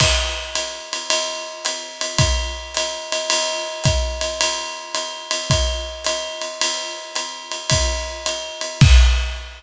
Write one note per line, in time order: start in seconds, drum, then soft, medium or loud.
0.00 kick medium
0.00 crash loud
0.00 ride loud
0.55 hi-hat pedal medium
0.55 ride medium
0.93 ride medium
1.10 ride loud
1.65 hi-hat pedal medium
1.65 ride medium
2.01 ride medium
2.18 kick medium
2.18 ride loud
2.74 hi-hat pedal medium
2.74 ride medium
3.12 ride medium
3.30 ride loud
3.84 kick medium
3.84 hi-hat pedal medium
3.84 ride medium
4.21 ride medium
4.41 ride loud
4.94 hi-hat pedal medium
4.94 ride medium
5.31 ride medium
5.50 kick medium
5.50 ride medium
6.04 hi-hat pedal medium
6.04 ride medium
6.42 ride medium
6.61 ride loud
7.15 hi-hat pedal medium
7.15 ride medium
7.51 ride medium
7.70 kick medium
7.70 ride loud
8.26 hi-hat pedal medium
8.26 ride medium
8.61 ride medium
8.81 kick loud
8.81 crash loud